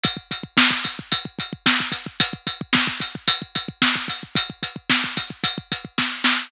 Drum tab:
HH |x-x---x-x-x---x-|x-x---x-x-x---x-|x-x---x-x-x-----|
SD |----o-------o---|----o-------o---|----o-------o-o-|
BD |oooooooooooooooo|oooooooooooooooo|ooooooooooooo---|